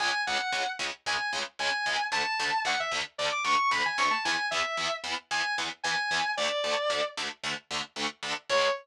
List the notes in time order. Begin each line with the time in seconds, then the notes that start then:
0.00 C#2 C#3 G#3 G#5
0.27 C#2 C#3 G#3 F#5
0.52 C#2 C#3 G#3
0.79 C#2 C#3 G#3
1.06 C#2 C#3 G#3 G#5
1.33 C#2 C#3 G#3
1.59 C#2 C#3 G#3 G#5
1.86 C#2 C#3 G#3
2.12 D2 D3 A3 A5
2.39 D2 D3 A3
2.65 D2 D3 A3 F#5
2.80 E5
2.91 D2 D3 A3
3.18 D2 D3 A3 D5
3.32 D6
3.44 D2 D3 A3 C#6
3.71 D2 D3 A3 B5
3.85 G#5
3.98 D2 D3 A3 C#6
4.11 A5
4.25 E2 E3 B3 G#5
4.51 E2 E3 B3 E5
4.77 E2 E3 B3
5.04 E2 E3 B3
5.31 E2 E3 B3 G#5
5.58 E2 E3 B3
5.84 E2 E3 B3 G#5
6.11 E2 E3 B3
6.37 D2 D3 A3 D5
6.64 D2 D3 A3
6.90 D2 D3 A3
7.17 D2 D3 A3
7.43 D2 D3 A3
7.71 D2 D3 A3
7.96 D2 D3 A3
8.23 D2 D3 A3
8.49 C#2 C#3 G#3 C#5